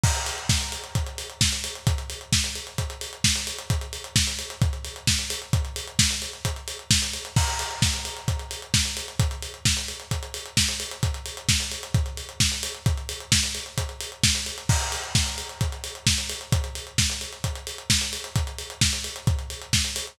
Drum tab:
CC |x---------------|----------------|----------------|----------------|
HH |-xox-xoxxxox-xox|xxox-xoxxxox-xox|xxox-xoxxxox-xox|xxox-xoxxxox-xox|
SD |----o-------o---|----o-------o---|----o-------o---|----o-------o---|
BD |o---o---o---o---|o---o---o---o---|o---o---o---o---|o---o---o---o---|

CC |x---------------|----------------|----------------|----------------|
HH |-xox-xoxxxox-xox|xxox-xoxxxox-xox|xxox-xoxxxox-xox|xxox-xoxxxox-xox|
SD |----o-------o---|----o-------o---|----o-------o---|----o-------o---|
BD |o---o---o---o---|o---o---o---o---|o---o---o---o---|o---o---o---o---|

CC |x---------------|----------------|----------------|
HH |-xox-xoxxxox-xox|xxox-xoxxxox-xox|xxox-xoxxxox-xox|
SD |----o-------o---|----o-------o---|----o-------o---|
BD |o---o---o---o---|o---o---o---o---|o---o---o---o---|